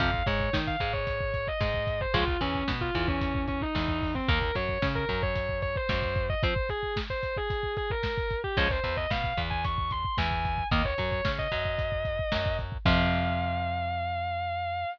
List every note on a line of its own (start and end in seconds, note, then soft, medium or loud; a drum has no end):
0.00 0.23 F2 medium
0.00 0.11 C3 medium
0.00 0.11 F3 medium
0.00 0.23 F5 loud
0.00 kick medium
0.00 closed hi-hat medium
0.14 kick medium
0.26 0.50 G#2 medium
0.26 0.50 G#3 medium
0.26 0.50 C#5 loud
0.26 kick medium
0.26 closed hi-hat medium
0.40 kick medium
0.53 0.76 D#3 medium
0.53 0.76 D#4 medium
0.53 kick medium
0.53 snare loud
0.67 0.89 F5 medium
0.67 kick medium
0.80 1.49 G#2 medium
0.80 1.49 G#3 medium
0.80 kick medium
0.80 closed hi-hat medium
0.93 1.31 C#5 loud
0.93 kick medium
1.07 kick medium
1.07 closed hi-hat medium
1.21 kick medium
1.34 1.47 C#5 loud
1.34 kick medium
1.34 closed hi-hat medium
1.47 2.00 D#5 medium
1.47 kick medium
1.60 2.06 G#2 medium
1.60 2.06 G#3 medium
1.60 kick medium
1.60 snare medium
1.74 kick medium
1.87 kick medium
1.87 closed hi-hat medium
2.01 2.14 C5 loud
2.01 kick medium
2.14 2.37 C#2 medium
2.14 2.25 C#3 medium
2.14 2.25 F3 medium
2.14 2.25 G#3 medium
2.14 2.36 F4 loud
2.14 kick medium
2.14 closed hi-hat loud
2.28 kick medium
2.41 2.64 E2 medium
2.41 2.64 E3 medium
2.41 2.64 C#4 loud
2.41 kick medium
2.41 closed hi-hat medium
2.55 kick medium
2.68 2.90 B2 medium
2.68 2.91 B3 medium
2.68 kick medium
2.68 snare loud
2.81 3.05 F4 medium
2.81 kick medium
2.95 3.63 E2 medium
2.95 3.63 E3 medium
2.95 kick medium
2.95 closed hi-hat medium
3.08 3.40 C#4 medium
3.08 kick medium
3.21 kick medium
3.21 closed hi-hat loud
3.35 kick medium
3.48 3.61 C#4 loud
3.48 kick medium
3.48 closed hi-hat medium
3.61 4.09 D#4 loud
3.61 kick medium
3.75 4.21 E2 medium
3.75 4.20 E3 medium
3.75 kick medium
3.75 snare medium
3.88 kick medium
4.02 kick medium
4.02 open hi-hat medium
4.15 4.27 C4 medium
4.15 kick medium
4.28 4.51 D#2 medium
4.28 4.39 D#3 medium
4.28 4.39 A#3 medium
4.28 4.55 A#4 loud
4.28 kick loud
4.28 closed hi-hat medium
4.42 kick medium
4.55 4.78 F#2 medium
4.55 4.78 F#3 medium
4.55 4.80 C#5 medium
4.55 kick medium
4.55 closed hi-hat medium
4.69 kick medium
4.82 5.05 C#3 medium
4.82 5.05 C#4 medium
4.82 kick medium
4.82 snare loud
4.95 5.18 A#4 loud
4.95 kick medium
5.09 5.77 F#2 medium
5.09 5.77 F#3 medium
5.09 kick medium
5.09 closed hi-hat medium
5.22 5.55 C#5 loud
5.22 kick medium
5.36 kick medium
5.36 closed hi-hat loud
5.49 kick medium
5.62 5.75 C#5 loud
5.62 kick medium
5.62 closed hi-hat medium
5.76 6.21 C5 loud
5.76 kick medium
5.89 6.35 F#2 medium
5.89 6.35 F#3 medium
5.89 kick medium
5.89 snare loud
6.02 kick medium
6.16 kick medium
6.16 closed hi-hat medium
6.29 6.42 D#5 loud
6.29 kick medium
6.43 6.54 F3 medium
6.43 6.54 C4 medium
6.43 6.66 C5 loud
6.43 kick loud
6.43 closed hi-hat medium
6.56 kick medium
6.69 6.91 G#4 loud
6.69 kick medium
6.69 closed hi-hat medium
6.83 kick medium
6.96 kick medium
6.96 snare loud
7.10 7.34 C5 loud
7.10 kick medium
7.23 kick medium
7.23 closed hi-hat medium
7.36 7.71 G#4 loud
7.36 kick medium
7.50 kick medium
7.50 closed hi-hat medium
7.63 kick medium
7.77 7.90 G#4 loud
7.77 kick medium
7.77 closed hi-hat medium
7.90 8.34 A#4 loud
7.90 kick medium
8.03 kick medium
8.03 snare loud
8.18 kick medium
8.30 kick medium
8.30 closed hi-hat medium
8.44 8.57 G4 loud
8.44 kick medium
8.57 8.80 C#2 medium
8.57 8.68 F3 loud
8.57 8.68 G#3 loud
8.57 8.68 C#4 medium
8.57 8.70 C#5 loud
8.57 kick medium
8.57 closed hi-hat medium
8.70 8.94 C5 loud
8.70 kick medium
8.84 9.06 E2 medium
8.84 9.06 E3 medium
8.84 kick medium
8.84 closed hi-hat medium
8.97 9.10 D#5 loud
8.97 kick medium
9.10 9.34 B2 medium
9.10 9.33 B3 medium
9.10 9.34 F5 medium
9.10 kick medium
9.10 snare loud
9.24 kick medium
9.37 10.06 E2 medium
9.37 10.06 E3 medium
9.37 kick medium
9.37 closed hi-hat medium
9.50 9.63 G#5 loud
9.50 kick medium
9.64 9.90 C#6 loud
9.64 kick medium
9.64 closed hi-hat medium
9.78 kick medium
9.91 10.14 C6 loud
9.91 kick medium
9.91 closed hi-hat medium
10.05 kick medium
10.18 10.63 E2 medium
10.18 10.64 E3 medium
10.18 10.62 G#5 medium
10.18 kick medium
10.18 snare loud
10.31 kick medium
10.45 kick medium
10.45 closed hi-hat medium
10.58 kick medium
10.71 10.94 D#2 medium
10.71 10.82 D#3 medium
10.71 10.82 A#3 loud
10.71 10.84 D#5 loud
10.71 kick loud
10.71 closed hi-hat loud
10.84 11.07 C#5 medium
10.84 kick medium
10.98 11.21 F#2 medium
10.98 11.21 F#3 medium
10.98 kick medium
10.98 closed hi-hat medium
11.11 11.24 C#5 medium
11.11 kick medium
11.25 11.48 C#3 medium
11.25 11.48 C#4 medium
11.25 kick medium
11.25 snare loud
11.39 12.52 D#5 loud
11.39 kick medium
11.52 12.20 F#2 medium
11.52 12.20 F#3 medium
11.52 kick medium
11.52 closed hi-hat medium
11.65 kick medium
11.78 kick medium
11.78 closed hi-hat medium
11.92 kick medium
12.05 kick medium
12.05 closed hi-hat medium
12.19 kick medium
12.32 12.78 F#2 medium
12.32 12.78 F#3 medium
12.32 kick medium
12.32 snare loud
12.46 kick medium
12.59 kick medium
12.59 closed hi-hat medium
12.72 kick medium
12.85 14.85 F2 loud
12.85 14.85 C3 loud
12.85 14.85 F3 loud
12.85 14.85 F5 loud
12.85 kick loud
12.85 crash loud